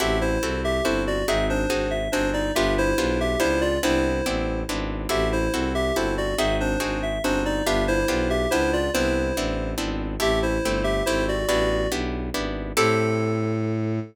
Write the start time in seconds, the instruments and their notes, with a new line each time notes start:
0.00 violin A1, acoustic guitar (steel) C4 E4 F#4 A4, electric piano 2 G4 E5
0.21 electric piano 2 E4 C5
0.42 violin C2, acoustic guitar (steel) C4 E4 F#4 A4
0.64 electric piano 2 G4 E5
0.84 violin G1, acoustic guitar (steel) C4 E4 F#4 A4, electric piano 2 E4 C5
1.07 electric piano 2 F#4 D5
1.28 violin G#1, acoustic guitar (steel) C4 D#4 F#4 G#4, electric piano 2 E5
1.50 electric piano 2 D4 C5
1.70 violin G#1, acoustic guitar (steel) C4 D#4 F#4 G#4
1.91 electric piano 2 E5
2.12 violin G1, acoustic guitar (steel) C4 D#4 F#4 G#4, electric piano 2 D4 C5
2.33 electric piano 2 D#4 D5
2.55 violin G1, acoustic guitar (steel) B3 D4 F4 G4, electric piano 2 G4 E5
2.78 electric piano 2 E4 C5
2.98 violin B1, acoustic guitar (steel) B3 D4 F4 G4
3.20 electric piano 2 G4 E5
3.39 violin C#2, acoustic guitar (steel) B3 D4 F4 G4, electric piano 2 E4 C5
3.61 electric piano 2 F4 D5
3.83 violin C2, acoustic guitar (steel) B3 C4 D4 E4, electric piano 2 E4 C5
4.26 violin A1, acoustic guitar (steel) B3 C4 D4 E4
4.68 violin G#1, acoustic guitar (steel) B3 C4 D4 E4
5.09 violin A1, acoustic guitar (steel) C4 E4 F#4 A4, electric piano 2 G4 E5
5.32 electric piano 2 E4 C5
5.53 violin C2, acoustic guitar (steel) C4 E4 F#4 A4
5.75 electric piano 2 G4 E5
5.96 violin G1, acoustic guitar (steel) C4 E4 F#4 A4, electric piano 2 E4 C5
6.17 electric piano 2 F#4 D5
6.38 violin G#1, acoustic guitar (steel) C4 D#4 F#4 G#4, electric piano 2 E5
6.60 electric piano 2 D4 C5
6.80 violin G#1, acoustic guitar (steel) C4 D#4 F#4 G#4
7.02 electric piano 2 E5
7.23 violin G1, acoustic guitar (steel) C4 D#4 F#4 G#4, electric piano 2 D4 C5
7.45 electric piano 2 D#4 D5
7.66 violin G1, acoustic guitar (steel) B3 D4 F4 G4, electric piano 2 G4 E5
7.88 electric piano 2 E4 C5
8.08 violin B1, acoustic guitar (steel) B3 D4 F4 G4
8.30 electric piano 2 G4 E5
8.51 violin C#2, acoustic guitar (steel) B3 D4 F4 G4, electric piano 2 E4 C5
8.73 electric piano 2 F4 D5
8.94 violin C2, acoustic guitar (steel) B3 C4 D4 E4, electric piano 2 E4 C5
9.36 violin A1, acoustic guitar (steel) B3 C4 D4 E4
9.78 violin G#1, acoustic guitar (steel) B3 C4 D4 E4
10.20 violin A1, acoustic guitar (steel) A3 C4 E4 G4, electric piano 2 G4 E5
10.43 electric piano 2 E4 C5
10.64 violin G1, acoustic guitar (steel) A3 C4 E4 G4
10.84 electric piano 2 G4 E5
11.06 violin G#1, acoustic guitar (steel) A3 C4 E4 G4, electric piano 2 E4 C5
11.28 electric piano 2 F#4 D5
11.48 violin A1, acoustic guitar (steel) B3 D4 E4 G4, electric piano 2 F#4 D5
11.91 violin B1, acoustic guitar (steel) B3 D4 E4 G4
12.34 violin G#1, acoustic guitar (steel) B3 D4 E4 G4
12.77 violin A2, acoustic guitar (steel) C4 E4 G4 A4, electric piano 2 A4